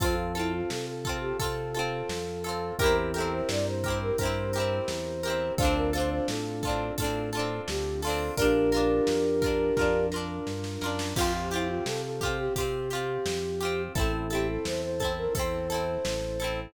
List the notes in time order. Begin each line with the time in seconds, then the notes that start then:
0.00 F2 C4 F4 A4, kick, closed hi-hat
0.04 C4
0.35 E4 F4 A4, closed hi-hat
0.39 C4
0.53 F4
0.70 C3 A4, snare
0.87 A4
1.05 F4 A4, kick, closed hi-hat
1.09 C4
1.21 G4
1.39 C3 F4 A4, kick, closed hi-hat
1.44 C4
1.74 F4 A4, closed hi-hat
1.79 C4
2.09 F2, snare
2.44 F4 A4, closed hi-hat
2.49 C4
2.79 E2 C4 E4 G4 A#4, kick, closed hi-hat
2.84 C4 E4
3.13 G4 A4 A#4, closed hi-hat
3.18 C4 E4
3.32 C5
3.49 G2 D5, snare
3.66 C5
3.84 G4 A#4, kick, closed hi-hat
3.88 C4 E4
4.02 A#4
4.18 G2 G4 A#4 C5, kick, closed hi-hat
4.23 C4 E4
4.53 G4 A#4, closed hi-hat
4.58 C4 E4
4.88 E2, snare
5.23 G4 A#4, closed hi-hat
5.27 C4 E4
5.58 D2 C4 D4 F4 A4 C5, kick, closed hi-hat
5.62 C4 D4
5.75 A#4
5.93 F4 A4 C5, closed hi-hat
5.97 C4 D4
6.10 C5
6.27 A2 A4, snare
6.63 F4 A4, kick, closed hi-hat
6.67 C4 D4
6.97 A2 F4 A4, kick, closed hi-hat
7.02 C4 D4
7.32 F4 A4, closed hi-hat
7.37 C4 D4
7.67 D2 G4, snare
8.02 F4 A4, open hi-hat
8.07 C4 D4
8.36 A#1 D4 F4 G4 A#4, kick, closed hi-hat
8.42 D4
8.72 F4 A#4, closed hi-hat
8.76 D4
9.07 F2, snare
9.42 F4 A#4, kick, closed hi-hat
9.46 D4
9.77 F2 F4 A#4, kick, snare
9.81 D4
10.12 F4 A#4, snare
10.16 D4
10.47 G2, snare
10.64 snare
10.81 F#2 F4 A#4, snare
10.86 D4
10.99 snare
11.15 F2 C4 F4 G4, kick, crash
11.21 C4
11.51 E4 F4 G4, closed hi-hat
11.56 C4
11.68 F4
11.85 C3 A4, snare
12.04 A4
12.21 F4 G4, kick, closed hi-hat
12.25 C4
12.38 G4
12.55 C3 F4 G4, kick, closed hi-hat
12.60 C4
12.90 F4 G4, closed hi-hat
12.95 C4
13.25 F2, snare
13.60 F4 G4, closed hi-hat
13.65 C4
13.95 A1 C4 E4 A4, kick, closed hi-hat
14.00 C4
14.30 E4 G4 A4, closed hi-hat
14.35 C4
14.48 A4
14.65 E2 C5, snare
14.82 C5
15.00 E4 A4, kick, closed hi-hat
15.05 C4
15.17 A#4
15.35 E2 E4 A4 C5, kick, closed hi-hat
15.39 C4
15.70 E4 A4, closed hi-hat
15.74 C4
16.05 A1, snare
16.40 E4 A4, closed hi-hat
16.44 C4